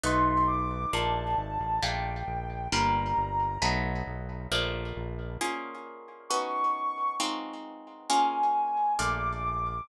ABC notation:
X:1
M:2/2
L:1/8
Q:1/2=134
K:Bb
V:1 name="Ocarina"
c'4 d'4 | a8 | g8 | b8 |
z8 | z8 | [K:Bbm] z8 | d'8 |
z8 | a8 | [K:Bb] d'8 |]
V:2 name="Acoustic Guitar (steel)"
[A,=B,^D^F]8 | [A,B,DF]8 | [A,B,DF]8 | [G,B,DF]8 |
[^F,A,=B,^D]8 | [F,A,B,D]8 | [K:Bbm] [B,DFA]8 | [_CDEG]8 |
[A,CEF]8 | [B,DFA]8 | [K:Bb] [A,B,DF]8 |]
V:3 name="Synth Bass 1" clef=bass
=B,,,8 | B,,,4 _A,,,2 =A,,,2 | B,,,4 B,,,4 | G,,,4 G,,,4 |
=B,,,4 B,,,4 | B,,,4 B,,,4 | [K:Bbm] z8 | z8 |
z8 | z8 | [K:Bb] B,,,8 |]